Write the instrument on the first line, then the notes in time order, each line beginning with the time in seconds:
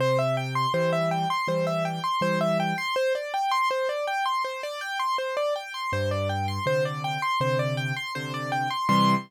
acoustic grand piano
0.00 C3 C5
0.19 E5
0.37 G5
0.55 C6
0.74 E3 G3 C5
0.93 E5
1.11 G5
1.30 C6
1.48 E3 G3 C5
1.67 E5
1.85 G5
2.04 C6
2.21 E3 G3 C5
2.41 E5
2.60 G5
2.78 C6
2.96 C5
3.15 D5
3.34 G5
3.51 C6
3.71 C5
3.89 D5
4.07 G5
4.26 C6
4.44 C5
4.63 D5
4.81 G5
5.00 C6
5.18 C5
5.37 D5
5.56 G5
5.74 C6
5.92 G2 C5
6.11 D5
6.29 G5
6.48 C6
6.66 C3 D3 C5
6.85 D5
7.04 G5
7.22 C6
7.40 C3 D3 C5
7.59 D5
7.77 G5
7.96 C6
8.15 C3 D3 C5
8.34 D5
8.52 G5
8.71 C6
8.89 C3 E3 G3 C6